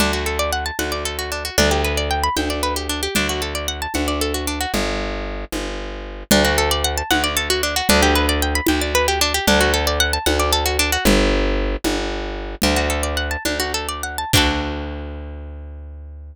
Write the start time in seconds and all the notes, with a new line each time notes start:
0.00 D2 D4, low conga
0.13 F#4
0.26 A4
0.39 D5
0.53 F#5
0.66 A5
0.79 D2 F#5, high conga
0.92 D5
1.05 A4
1.19 F#4
1.32 D4
1.45 F#4
1.58 D2 D4, low conga
1.71 G4
1.84 B4
1.97 D5
2.11 G5
2.24 B5
2.37 D2 G5, high conga
2.50 D5
2.63 B4
2.76 G4
2.89 D4
3.03 G4
3.15 D2 D4, low conga
3.29 F#4
3.42 A4
3.55 D5
3.68 F#5
3.82 A5
3.94 D2 F#5, high conga
4.08 D5
4.21 A4
4.34 F#4
4.47 D4
4.61 F#4
4.74 G1, low conga
5.52 G1, high conga
6.31 D2 D4, low conga
6.45 F#4
6.58 A4
6.71 D5
6.84 F#5
6.97 A5
7.11 D2 F#5, high conga
7.24 D5
7.37 A4
7.50 F#4
7.63 D4
7.76 F#4
7.89 D2 D4, low conga
8.03 G4
8.15 B4
8.29 D5
8.42 G5
8.55 B5
8.67 D2 G5, high conga
8.81 D5
8.95 B4
9.08 G4
9.21 D4
9.34 G4
9.47 D2 D4, low conga
9.61 F#4
9.74 A4
9.87 D5
10.00 F#5
10.13 A5
10.26 D2 F#5, high conga
10.40 D5
10.53 A4
10.66 F#4
10.79 D4
10.92 F#4
11.05 G1, low conga
11.84 G1, high conga
12.62 D2 D4, low conga
12.76 F#4
12.90 A4
13.03 D5
13.17 F#5
13.31 A5
13.45 D2 D4, high conga
13.60 F#4
13.74 A4
13.89 D5
14.03 F#5
14.18 A5
14.33 D2 D4 F#4 A4, kick, crash